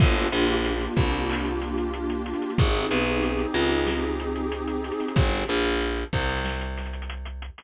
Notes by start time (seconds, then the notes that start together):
0.00 G1 A#3 D4 F4 G4, kick, crash
0.16 snare, closed hi-hat
0.32 A#1, closed hi-hat
0.49 closed hi-hat
0.65 closed hi-hat
0.81 closed hi-hat
0.97 C2, kick, closed hi-hat
1.12 closed hi-hat
1.29 clap
1.45 closed hi-hat
1.61 snare, closed hi-hat
1.78 closed hi-hat
1.93 closed hi-hat
2.10 closed hi-hat
2.26 closed hi-hat
2.34 closed hi-hat
2.42 closed hi-hat
2.50 closed hi-hat
2.58 G#1 C4 D#4 G4 G#4, kick, closed hi-hat
2.74 closed hi-hat
2.90 B1, closed hi-hat
3.06 closed hi-hat
3.23 closed hi-hat
3.39 closed hi-hat
3.54 C#2, closed hi-hat
3.71 closed hi-hat
3.87 snare
4.03 closed hi-hat
4.20 closed hi-hat
4.35 closed hi-hat
4.52 closed hi-hat
4.67 closed hi-hat
4.84 closed hi-hat
4.92 closed hi-hat
5.00 snare, closed hi-hat
5.08 closed hi-hat
5.16 G1, kick, closed hi-hat
5.32 closed hi-hat
5.48 A#1, closed hi-hat
5.65 closed hi-hat
5.81 closed hi-hat
5.97 closed hi-hat
6.13 C2, kick, closed hi-hat
6.21 closed hi-hat
6.29 closed hi-hat
6.37 closed hi-hat
6.45 snare
6.61 closed hi-hat
6.77 snare, closed hi-hat
6.85 closed hi-hat
6.93 closed hi-hat
7.02 closed hi-hat
7.09 closed hi-hat
7.25 closed hi-hat
7.42 closed hi-hat
7.58 snare, closed hi-hat